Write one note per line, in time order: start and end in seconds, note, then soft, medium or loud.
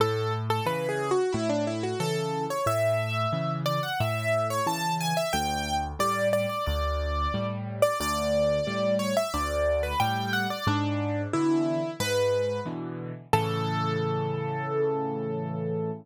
0.00 0.60 A2 medium
0.00 0.33 A4 medium
0.50 0.66 A4 medium
0.66 1.13 C#3 medium
0.66 1.13 E3 medium
0.66 0.88 B4 medium
0.89 1.10 G#4 medium
1.11 1.32 F#4 medium
1.33 1.94 A2 loud
1.33 1.48 E4 medium
1.49 1.65 D4 medium
1.67 1.83 E4 medium
1.83 1.99 F#4 medium
2.00 2.47 C#3 medium
2.00 2.47 E3 medium
2.00 2.44 A4 medium
2.50 2.66 C#5 medium
2.66 3.26 A2 medium
2.66 3.52 E5 loud
3.33 3.79 C#3 medium
3.33 3.79 E3 medium
3.66 3.82 D5 medium
3.83 3.99 F#5 medium
4.00 4.60 A2 medium
4.00 4.47 E5 medium
4.50 4.66 C#5 medium
4.67 5.13 C#3 medium
4.67 5.13 E3 medium
4.67 4.95 A5 medium
5.01 5.16 G#5 medium
5.17 5.33 E5 medium
5.33 5.94 D2 loud
5.33 5.75 G5 loud
5.99 6.46 A2 medium
5.99 6.46 G3 medium
5.99 6.28 D5 medium
6.33 6.49 D5 medium
6.49 6.65 D5 medium
6.66 7.27 D2 medium
6.66 7.47 D5 medium
7.34 7.81 A2 medium
7.34 7.81 G3 medium
7.82 7.98 D5 medium
8.00 8.60 D2 medium
8.00 8.95 D5 loud
8.67 9.14 A2 medium
8.67 9.14 G3 medium
8.99 9.15 C#5 medium
9.17 9.33 E5 medium
9.34 9.94 D2 medium
9.34 9.83 D5 medium
9.83 9.99 B4 medium
10.00 10.47 A2 medium
10.00 10.47 G3 medium
10.00 10.31 G5 medium
10.33 10.49 F#5 medium
10.50 10.66 D5 medium
10.67 11.27 G#2 loud
10.67 11.22 D4 loud
11.33 11.81 B2 medium
11.33 11.81 D3 medium
11.33 11.81 E3 medium
11.33 11.91 E4 medium
12.00 12.60 G#2 medium
12.00 12.60 B4 medium
12.66 13.12 B2 medium
12.66 13.12 D3 medium
12.66 13.12 E3 medium
13.33 15.91 A2 loud
13.33 15.91 C#3 loud
13.33 15.91 E3 medium
13.33 15.91 A4 loud